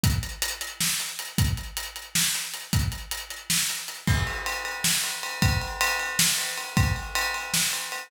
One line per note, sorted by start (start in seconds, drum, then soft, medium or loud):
0.04 kick medium
0.04 closed hi-hat medium
0.23 closed hi-hat medium
0.42 closed hi-hat loud
0.61 closed hi-hat medium
0.81 snare medium
1.00 closed hi-hat medium
1.19 closed hi-hat medium
1.38 kick medium
1.38 closed hi-hat medium
1.57 closed hi-hat medium
1.77 closed hi-hat medium
1.96 closed hi-hat medium
2.15 snare medium
2.35 closed hi-hat medium
2.54 closed hi-hat medium
2.73 kick medium
2.73 closed hi-hat medium
2.92 closed hi-hat medium
3.11 closed hi-hat medium
3.30 closed hi-hat medium
3.50 snare medium
3.69 closed hi-hat medium
3.88 closed hi-hat medium
4.07 kick medium
4.07 crash medium
4.27 ride medium
4.46 ride medium
4.65 ride medium
4.84 snare medium
5.04 ride medium
5.23 ride medium
5.42 kick medium
5.42 ride loud
5.62 ride medium
5.81 ride loud
6.00 ride medium
6.19 snare loud
6.38 ride medium
6.58 ride medium
6.77 kick loud
6.77 ride medium
6.96 ride medium
7.15 ride loud
7.34 ride medium
7.54 snare medium
7.73 ride medium
7.92 ride medium